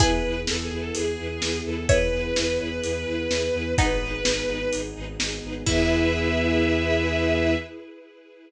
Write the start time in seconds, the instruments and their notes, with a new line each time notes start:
0.00 violin E2 B4, string ensemble 1 B3 E4 G#4 B4, pizzicato strings E4 G#4, kick, closed hi-hat
0.25 violin E2, string ensemble 1 E4 G#4 B4
0.47 violin E2 A4, string ensemble 1 E4 G#4 B4, snare
0.63 violin G#4
0.71 violin E2, string ensemble 1 E4 G#4 B4
0.79 violin A4
0.94 violin E2 G#4, string ensemble 1 E4 G#4 B4, closed hi-hat
1.18 violin E2, string ensemble 1 E4 G#4 B4
1.40 violin E2, string ensemble 1 E4 G#4 B4, snare
1.65 violin E2 A4, string ensemble 1 E4 G#4 B4
1.88 violin E2 B4, string ensemble 1 E4 G#4 B4, pizzicato strings C#5 E5, kick, closed hi-hat
2.12 violin E2, string ensemble 1 E4 G#4 B4
2.35 violin E2, string ensemble 1 E4 G#4 B4, snare
2.59 violin E2, string ensemble 1 E4 G#4 B4
2.83 violin E2, string ensemble 1 E4 G#4 B4, closed hi-hat
3.06 violin E2, string ensemble 1 E4 G#4 B4
3.29 violin E2, string ensemble 1 E4 G#4 B4, snare
3.53 violin E2, string ensemble 1 E4 G#4 B4
3.77 violin G#1 B4, string ensemble 1 B3 D#4 G#4 B4, pizzicato strings B3 D#4, kick, closed hi-hat
4.00 violin G#1, string ensemble 1 D#4 G#4 B4
4.24 violin G#1, string ensemble 1 D#4 G#4 B4, snare
4.47 violin G#1, string ensemble 1 D#4 G#4 B4
4.72 violin G#1, string ensemble 1 D#4 G#4 B4, closed hi-hat
4.95 violin G#1, string ensemble 1 D#4 G#4 B4
5.19 violin G#1, string ensemble 1 D#4 G#4 B4, snare
5.43 violin G#1, string ensemble 1 D#4 G#4 B4
5.66 violin E2 E5, string ensemble 1 B3 E4 G#4 B4, pizzicato strings E4, kick, crash